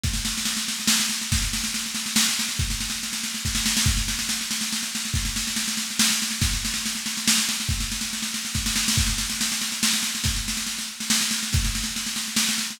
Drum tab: SD |oooooooooooo|oooooooooooo|oooooooooooo|oooooooooooo|
BD |o-----------|o-----------|o-------o---|o-----------|

SD |oooooooooooo|oooooooooooo|oooooooooooo|oooooooooooo|
BD |o-----------|o-----------|o-------o---|o-----------|

SD |oooooo-ooooo|oooooooooooo|
BD |o-----------|o-----------|